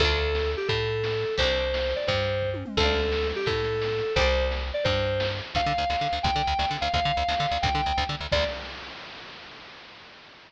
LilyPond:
<<
  \new Staff \with { instrumentName = "Electric Piano 2" } { \time 6/8 \key d \dorian \tempo 4. = 173 a'2~ a'8 g'8 | a'2. | c''2~ c''8 d''8 | c''2 r4 |
a'2~ a'8 g'8 | a'2. | c''4~ c''16 r4 r16 d''8 | c''2 r4 |
f''2. | g''2~ g''8 f''8 | f''2. | g''2 r4 |
d''4. r4. | }
  \new Staff \with { instrumentName = "Pizzicato Strings" } { \time 6/8 \key d \dorian <d' f' a'>2.~ | <d' f' a'>2. | <c' d' g'>2.~ | <c' d' g'>2. |
<d'' f'' a''>2.~ | <d'' f'' a''>2. | <c'' d'' g''>2.~ | <c'' d'' g''>2. |
r2. | r2. | r2. | r2. |
r2. | }
  \new Staff \with { instrumentName = "Electric Bass (finger)" } { \clef bass \time 6/8 \key d \dorian d,2. | a,2. | c,2. | g,2. |
d,2. | a,2. | c,2. | g,2. |
d,8 d8 d,8 d,8 d8 d,8 | d,8 d8 d,8 d,8 d8 d,8 | d,8 d8 d,8 d,8 d8 d,8 | d,8 d8 d,8 d,8 d8 d,8 |
d,4. r4. | }
  \new DrumStaff \with { instrumentName = "Drums" } \drummode { \time 6/8 <hh bd>8. hh8. sn8. hh8. | <hh bd>8. hh8. sn8. hh8. | <hh bd>8. hh8. sn8. hho8. | <hh bd>8. hh8. bd8 tommh8 toml8 |
<cymc bd>8. hh8. sn8. hh8. | <hh bd>8. hh8. sn8. hh8. | <hh bd>8. hh8. sn8. hh8. | <hh bd>8. hh8. sn8. hh8. |
<hh bd>8. hh8. sn8. hh8. | <hh bd>8. hh8. sn8. hh8. | <hh bd>8. hh8. sn8. hh8. | <hh bd>8. hh8. <bd sn>8 sn4 |
<cymc bd>4. r4. | }
>>